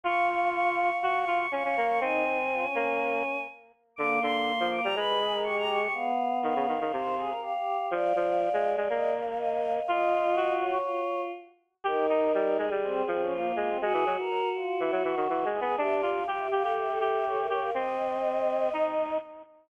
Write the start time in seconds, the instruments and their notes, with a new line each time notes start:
0.03 lead 1 (square) F4, choir aahs F5 C#6
0.29 choir aahs C#6
0.53 choir aahs C#6
0.77 choir aahs C#6
1.03 lead 1 (square) F#4, choir aahs C#6
1.18 choir aahs C#6
1.27 lead 1 (square) F4
1.36 choir aahs C#6
1.51 lead 1 (square) C#4, choir aahs F5 C#6
1.64 lead 1 (square) C#4, choir aahs C#6
1.77 lead 1 (square) A#3
1.87 choir aahs C#6
1.99 lead 1 (square) C4, choir aahs D#4 G#5
2.25 choir aahs D#4
2.52 choir aahs F4
2.61 choir aahs C#4
2.75 lead 1 (square) A#3
3.96 lead 1 (square) D3, choir aahs A#3 D6
4.21 lead 1 (square) D3, choir aahs C6
4.59 lead 1 (square) F3
4.71 choir aahs D6
4.82 lead 1 (square) G3, choir aahs A#5
4.95 lead 1 (square) G#3, choir aahs B4 B5
5.21 choir aahs G#4
5.31 choir aahs A#4
5.43 choir aahs G4 C#6
5.57 choir aahs G4 A#5
5.69 choir aahs C#6
5.81 choir aahs G4 C#6
5.93 choir aahs B3 F5
6.43 lead 1 (square) D#3, choir aahs F5
6.55 lead 1 (square) C#3
6.68 lead 1 (square) D#3
6.80 lead 1 (square) D#3
6.92 lead 1 (square) C3, choir aahs C5
7.17 choir aahs G#4
7.29 choir aahs A#4
7.41 choir aahs G4 F5
7.54 choir aahs G4
7.78 choir aahs G4
7.91 lead 1 (square) F3, choir aahs D5 F5
8.15 lead 1 (square) F3
8.53 lead 1 (square) G#3
8.77 lead 1 (square) G#3
8.89 lead 1 (square) A#3, choir aahs D#5
9.13 choir aahs F5
9.26 choir aahs F5
9.37 choir aahs D#5 F5
9.51 choir aahs F5
9.77 choir aahs F5
9.87 lead 1 (square) F4, choir aahs F4 D#5
10.36 lead 1 (square) F#4
10.60 choir aahs C#5
10.85 choir aahs F4
11.84 choir aahs D#4 A#4, lead 1 (square) G4
12.09 lead 1 (square) D#4
12.34 lead 1 (square) G3
12.57 lead 1 (square) G#3, choir aahs G#4
12.70 lead 1 (square) G3
12.83 choir aahs C4
13.07 lead 1 (square) F3, choir aahs C4
13.21 choir aahs C#4
13.30 choir aahs A#3 F4
13.56 lead 1 (square) G#3, choir aahs A#3
13.68 choir aahs C4
13.81 lead 1 (square) G#3, choir aahs F#4 G#4
13.93 lead 1 (square) E3
14.06 lead 1 (square) F#3
14.19 choir aahs A#4
14.55 choir aahs F4
14.80 lead 1 (square) E3, choir aahs E4
14.91 lead 1 (square) F#3
15.02 lead 1 (square) E3, choir aahs F#4
15.16 lead 1 (square) D#3
15.29 lead 1 (square) E3
15.45 lead 1 (square) G#3
15.53 choir aahs G#4
15.60 lead 1 (square) B3
15.78 lead 1 (square) D4, choir aahs G4 E5
15.93 choir aahs D5
16.02 lead 1 (square) F4
16.11 choir aahs F5
16.27 choir aahs G4 F5, lead 1 (square) G4
16.38 choir aahs E5
16.51 lead 1 (square) G4, choir aahs F5
16.62 lead 1 (square) G4, choir aahs A4
16.77 choir aahs E5
16.89 choir aahs A4 E5
17.00 lead 1 (square) G4
17.09 choir aahs E5
17.25 choir aahs A4 C#5
17.37 choir aahs E5
17.41 choir aahs A#4
17.48 lead 1 (square) G4, choir aahs C#5
17.58 choir aahs A#4 F5
17.74 lead 1 (square) C4, choir aahs D#5
18.73 lead 1 (square) D#4